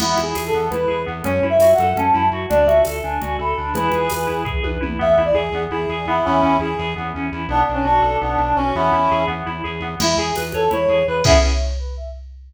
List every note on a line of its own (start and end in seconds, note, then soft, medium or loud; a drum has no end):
0.00 0.15 E2 medium
0.00 0.16 B3 medium
0.00 0.18 E4 loud
0.00 crash loud
0.00 low conga loud
0.17 0.34 E2 medium
0.17 0.33 E4 medium
0.17 high conga medium
0.23 0.43 G#4 medium
0.35 0.51 E2 medium
0.35 0.51 G#4 medium
0.35 tambourine medium
0.35 high conga medium
0.47 0.67 A4 medium
0.54 0.69 E2 medium
0.54 0.70 B3 medium
0.70 0.86 E2 medium
0.70 0.89 E4 medium
0.70 1.00 B4 medium
0.70 low conga medium
0.88 1.06 E2 medium
0.88 1.04 G#4 medium
1.06 1.23 E2 medium
1.06 1.22 B3 medium
1.24 1.40 F#2 loud
1.24 1.41 C#4 medium
1.24 1.44 C#5 medium
1.24 low conga medium
1.43 1.58 F#2 medium
1.43 1.59 E4 medium
1.50 1.73 E5 loud
1.59 1.74 F#2 medium
1.59 1.77 F#4 medium
1.59 tambourine medium
1.59 high conga medium
1.73 1.96 F#5 medium
1.78 1.94 F#2 loud
1.78 1.96 A4 medium
1.78 high conga medium
1.96 2.11 F#2 medium
1.96 2.13 C#4 medium
1.96 2.26 A5 medium
1.96 low conga medium
2.14 2.30 F#2 medium
2.14 2.30 E4 medium
2.31 2.46 F#2 medium
2.31 2.49 F#4 medium
2.49 2.66 D2 loud
2.49 2.66 D4 medium
2.49 2.66 D5 loud
2.49 low conga medium
2.66 2.82 D2 medium
2.66 2.84 F#4 medium
2.66 2.81 E5 medium
2.66 high conga medium
2.85 3.01 D2 medium
2.85 3.03 A4 medium
2.85 tambourine medium
2.85 high conga medium
3.03 3.19 D2 medium
3.03 3.20 D4 medium
3.03 3.36 G#5 medium
3.21 3.38 D2 medium
3.21 3.37 F#4 medium
3.21 low conga medium
3.39 3.54 D2 medium
3.39 3.55 A4 medium
3.39 3.72 B5 medium
3.57 3.73 D2 medium
3.57 3.73 D4 medium
3.74 3.89 E2 loud
3.74 3.92 E4 loud
3.74 4.41 G#4 medium
3.74 4.41 B4 medium
3.74 low conga medium
3.92 4.09 E2 medium
3.92 4.11 G#4 medium
3.92 high conga medium
4.10 4.27 E2 medium
4.10 4.26 B4 medium
4.10 tambourine medium
4.10 high conga medium
4.27 4.44 E2 medium
4.27 4.43 E4 medium
4.45 4.60 E2 medium
4.45 4.61 G#4 medium
4.45 kick medium
4.63 4.78 E2 medium
4.63 4.80 B4 medium
4.63 high tom medium
4.81 4.98 E2 medium
4.81 4.97 E4 medium
4.81 mid tom medium
4.99 5.16 E2 loud
4.99 5.15 B3 medium
4.99 5.10 E5 loud
5.11 5.22 E5 loud
5.17 5.33 E2 medium
5.17 5.34 E4 medium
5.25 5.37 D5 medium
5.34 5.50 E2 medium
5.34 5.63 G#4 medium
5.34 5.51 G#4 medium
5.52 5.68 E2 medium
5.52 5.71 B3 medium
5.71 5.86 E2 medium
5.71 5.88 E4 medium
5.71 6.06 G#4 medium
5.89 6.05 E2 medium
5.89 6.06 G#4 medium
6.05 6.21 E2 medium
6.05 6.42 B3 medium
6.05 6.23 E4 loud
6.25 6.42 E2 loud
6.25 6.56 C#4 loud
6.25 6.56 E4 loud
6.42 6.58 E2 medium
6.42 6.58 C#4 medium
6.60 6.75 E2 medium
6.60 6.76 E4 medium
6.60 6.93 G#4 medium
6.78 6.94 E2 loud
6.78 6.94 G#4 medium
6.96 7.13 E2 medium
6.96 7.12 B3 medium
7.15 7.30 E2 medium
7.15 7.31 C#4 medium
7.32 7.47 E2 medium
7.32 7.48 E4 medium
7.48 7.63 B1 loud
7.48 7.66 B3 medium
7.48 7.61 D4 loud
7.61 7.72 D4 medium
7.69 7.84 B1 medium
7.69 7.85 D4 medium
7.74 7.85 C#4 medium
7.85 8.00 B1 medium
7.85 8.17 D4 loud
7.85 8.01 F#4 medium
8.02 8.17 B1 medium
8.02 8.18 A4 medium
8.21 8.37 B1 loud
8.21 8.38 B3 medium
8.21 8.55 D4 medium
8.38 8.53 B1 loud
8.38 8.55 D4 medium
8.56 8.72 B1 medium
8.56 8.73 C#4 loud
8.56 8.75 F#4 medium
8.75 8.91 E2 loud
8.75 8.92 B3 medium
8.75 9.23 C#4 medium
8.75 9.23 E4 loud
8.93 9.08 E2 medium
8.93 9.09 E4 medium
9.11 9.26 E2 medium
9.11 9.28 G#4 medium
9.27 9.43 E2 medium
9.27 9.43 B3 medium
9.46 9.62 E2 medium
9.46 9.62 E4 medium
9.64 9.80 E2 medium
9.64 9.80 G#4 medium
9.80 9.96 E2 medium
9.80 9.98 B3 medium
10.00 10.15 E2 loud
10.00 10.17 E4 medium
10.00 10.16 E4 loud
10.00 crash loud
10.00 low conga loud
10.17 10.32 E2 medium
10.17 10.35 G#4 loud
10.17 10.35 G#4 medium
10.35 10.53 E2 medium
10.35 10.52 B4 medium
10.35 tambourine medium
10.35 high conga medium
10.52 10.69 E2 medium
10.52 10.70 A4 medium
10.52 10.70 C#5 medium
10.52 high conga medium
10.71 10.87 E2 medium
10.71 10.87 E4 medium
10.71 10.89 C#5 loud
10.71 low conga medium
10.88 11.04 E2 medium
10.88 11.05 G#4 medium
10.88 11.05 C#5 medium
11.07 11.23 E2 medium
11.07 11.22 B4 medium
11.07 11.24 B4 medium
11.24 11.38 E2 loud
11.24 11.37 B3 medium
11.24 11.37 C#4 loud
11.24 11.37 E4 loud
11.24 11.37 G#4 loud
11.24 11.38 E5 loud
11.24 kick loud
11.24 crash loud